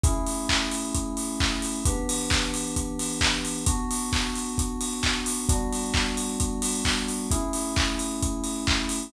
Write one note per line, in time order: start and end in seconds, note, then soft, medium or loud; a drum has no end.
0.04 1.82 A3 medium
0.04 1.82 C#4 medium
0.04 1.82 E4 medium
0.04 1.82 G#4 medium
0.04 kick loud
0.04 closed hi-hat loud
0.27 open hi-hat medium
0.49 kick medium
0.49 clap loud
0.71 open hi-hat medium
0.94 kick medium
0.94 closed hi-hat loud
1.17 open hi-hat medium
1.40 kick medium
1.40 clap loud
1.62 open hi-hat medium
1.85 3.64 E3 medium
1.85 3.64 B3 medium
1.85 3.64 D4 medium
1.85 3.64 G4 medium
1.85 kick loud
1.85 closed hi-hat loud
2.09 open hi-hat loud
2.30 kick medium
2.30 clap loud
2.54 open hi-hat medium
2.76 kick medium
2.76 closed hi-hat loud
2.99 open hi-hat medium
3.21 kick medium
3.21 clap loud
3.45 open hi-hat medium
3.66 5.46 B3 medium
3.66 5.46 D4 medium
3.66 5.46 F#4 medium
3.66 kick loud
3.66 closed hi-hat loud
3.91 open hi-hat medium
4.13 kick medium
4.13 clap loud
4.35 open hi-hat medium
4.58 kick medium
4.58 closed hi-hat loud
4.81 open hi-hat medium
5.03 kick medium
5.03 clap loud
5.26 open hi-hat medium
5.49 7.27 G3 medium
5.49 7.27 B3 medium
5.49 7.27 D4 medium
5.49 7.27 F#4 medium
5.49 kick loud
5.49 closed hi-hat loud
5.73 open hi-hat medium
5.94 kick medium
5.94 clap loud
6.17 open hi-hat medium
6.40 kick medium
6.40 closed hi-hat loud
6.62 open hi-hat loud
6.85 kick medium
6.85 clap loud
7.08 open hi-hat medium
7.31 9.09 A3 medium
7.31 9.09 C#4 medium
7.31 9.09 E4 medium
7.31 9.09 G#4 medium
7.31 kick loud
7.31 closed hi-hat loud
7.53 open hi-hat medium
7.76 kick loud
7.76 clap loud
7.99 open hi-hat medium
8.22 kick medium
8.22 closed hi-hat loud
8.44 open hi-hat medium
8.67 kick medium
8.67 clap loud
8.89 open hi-hat medium